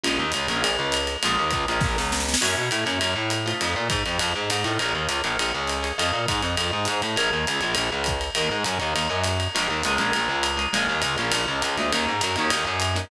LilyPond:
<<
  \new Staff \with { instrumentName = "Acoustic Guitar (steel)" } { \time 4/4 \key bes \minor \tempo 4 = 202 <aes bes des' f'>4. <aes bes des' f'>2~ <aes bes des' f'>8 | <aes bes des' f'>4. <aes bes des' f'>2~ <aes bes des' f'>8 | <bes des' fes' ges'>4. <bes des' fes' ges'>2 <a c' ees' f'>8~ | <a c' ees' f'>2.~ <a c' ees' f'>8 <a c' ees' f'>8 |
<aes' bes' des'' f''>4. <aes' bes' des'' f''>2 <aes' bes' des'' f''>8 | <a' c'' ees'' f''>1 | <aes' bes' des'' f''>4. <aes' bes' des'' f''>2~ <aes' bes' des'' f''>8 | <bes' des'' ees'' ges''>4. <bes' des'' ees'' ges''>4 <bes' des'' ees'' ges''>4. |
<aes bes des' f'>4 <aes bes des' f'>8 <aes bes des' f'>2 <aes bes des' f'>8 | <aes bes des' f'>4. <aes bes des' f'>2 <aes bes des' f'>8 | <bes des' ees' ges'>4. <bes des' ees' ges'>2 <bes des' ees' ges'>8 | }
  \new Staff \with { instrumentName = "Electric Bass (finger)" } { \clef bass \time 4/4 \key bes \minor bes,,8 ees,8 des,8 bes,,8 bes,,8 des,4. | bes,,8 ees,8 des,8 bes,,8 bes,,8 des,4. | ges,8 b,8 a,8 ges,8 ges,8 a,4. | f,8 bes,8 aes,8 f,8 f,8 aes,8 aes,8 a,8 |
bes,,8 ees,8 des,8 bes,,8 bes,,8 des,4. | f,8 bes,8 aes,8 f,8 f,8 aes,8 aes,8 a,8 | bes,,8 ees,8 des,8 bes,,8 bes,,8 des,4. | ees,8 aes,8 ges,8 ees,8 ees,8 ges,4. |
bes,,8 ees,8 des,8 bes,,8 bes,,8 des,4. | bes,,8 ees,8 des,8 bes,,8 bes,,8 des,8 des,8 d,8 | ees,8 aes,8 ges,8 ees,8 ees,8 ges,4. | }
  \new DrumStaff \with { instrumentName = "Drums" } \drummode { \time 4/4 cymr4 <hhp cymr>8 cymr8 cymr4 <hhp cymr>8 cymr8 | cymr4 <hhp bd cymr>8 cymr8 <bd sn>8 sn8 sn16 sn16 sn16 sn16 | <cymc cymr>4 <hhp cymr>8 cymr8 cymr4 <hhp cymr>8 cymr8 | cymr4 <hhp bd cymr>8 cymr8 cymr4 <hhp cymr>8 cymr8 |
cymr4 <hhp cymr>8 cymr8 cymr4 <hhp cymr>8 cymr8 | cymr4 <hhp bd cymr>8 cymr8 cymr4 <hhp cymr>8 cymr8 | cymr4 <hhp cymr>8 cymr8 cymr4 <hhp bd cymr>8 cymr8 | cymr4 <hhp cymr>8 cymr8 cymr4 <hhp cymr>8 cymr8 |
cymr4 <hhp cymr>8 cymr8 cymr4 <hhp cymr>8 cymr8 | cymr4 <hhp cymr>8 cymr8 cymr4 <hhp cymr>8 cymr8 | cymr4 <hhp cymr>8 cymr8 cymr4 <hhp cymr>8 <hhp cymr>8 | }
>>